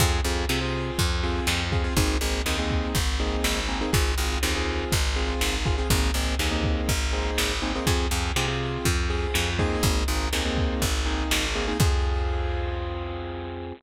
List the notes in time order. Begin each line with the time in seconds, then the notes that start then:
0.00 F2 C4 F4 G#4, kick, crash
0.24 F2 C4 F4 G#4, closed hi-hat
0.49 C3 C4 F4 G#4, snare
0.61 C4 F4 G#4
0.74 closed hi-hat
0.98 F2, kick, closed hi-hat
1.23 C4 F4 G#4, snare, closed hi-hat
1.47 F2, snare
1.72 C4 F4 G#4, kick, closed hi-hat
1.84 C4 F4 G#4
1.97 G#1 A#3 C4 D#4 G#4, kick, closed hi-hat
2.21 G#1 A#3 C4 D#4 G#4, closed hi-hat
2.46 D#2 A#3 C4 D#4 G#4, snare
2.59 A#3 C4 D#4 G#4
2.70 kick, closed hi-hat
2.95 G#1, kick, closed hi-hat
3.20 A#3 C4 D#4 G#4, snare, closed hi-hat
3.44 G#1, snare
3.69 A#3 C4 D#4 G#4, closed hi-hat
3.81 A#3 C4 D#4 G#4
3.93 G#1 C4 F4 G#4, kick, closed hi-hat
4.18 G#1 C4 F4 G#4, closed hi-hat
4.43 D#2 C4 F4 G#4, snare
4.55 C4 F4 G#4
4.67 closed hi-hat
4.92 G#1, kick, closed hi-hat
5.16 C4 F4 G#4, snare, closed hi-hat
5.41 G#1, snare
5.66 C4 F4 G#4, kick, closed hi-hat
5.78 C4 F4 G#4
5.90 G#1 A#3 C4 D#4 G#4, kick, closed hi-hat
6.14 G#1 A#3 C4 D#4 G#4, closed hi-hat
6.39 D#2 A#3 C4 D#4 G#4, snare
6.51 A#3 C4 D#4 G#4
6.64 kick, closed hi-hat
6.89 G#1, kick, closed hi-hat
7.13 A#3 C4 D#4 G#4, snare, closed hi-hat
7.38 G#1, snare
7.62 A#3 C4 D#4 G#4, closed hi-hat
7.75 A#3 C4 D#4 G#4
7.87 F2 C4 F4 G#4, kick, closed hi-hat
8.11 F2 C4 F4 G#4, closed hi-hat
8.36 C3 C4 F4 G#4, snare
8.48 C4 F4 G#4
8.61 closed hi-hat
8.85 F2, kick, closed hi-hat
9.10 C4 F4 G#4, snare, closed hi-hat
9.34 F2, snare
9.59 A#3 C4 D#4 G#4, kick, closed hi-hat
9.83 G#1, kick, closed hi-hat
10.08 G#1 A#3 C4 D#4 G#4, closed hi-hat
10.33 D#2 A#3 C4 D#4 G#4, snare
10.45 A#3 C4 D#4 G#4
10.57 kick, closed hi-hat
10.82 G#1, kick, closed hi-hat
11.06 A#3 C4 D#4 G#4, snare, closed hi-hat
11.31 G#1, snare
11.55 A#3 C4 D#4 G#4, open hi-hat
11.68 A#3 C4 D#4 G#4
11.80 F2 C4 F4 G#4, kick, crash